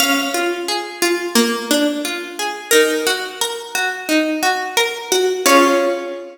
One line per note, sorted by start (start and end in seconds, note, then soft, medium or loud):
0.00 0.31 C#4 loud
0.00 2.25 F5 loud
0.34 0.65 F4 medium
0.68 0.99 G#4 medium
1.02 1.33 F4 medium
1.35 1.66 A#3 medium
1.71 2.01 D4 medium
2.05 2.36 F4 medium
2.39 2.70 G#4 medium
2.71 3.03 D#4 medium
2.71 4.20 A#4 loud
3.07 3.37 F#4 medium
3.41 3.72 A#4 medium
3.75 4.06 F#4 medium
4.09 4.39 D#4 medium
4.43 4.73 F#4 medium
4.77 5.08 A#4 medium
5.12 5.42 F#4 medium
5.46 6.38 C#4 medium
5.46 6.38 F4 loud
5.46 6.38 G#4 loud
5.46 6.38 C#5 loud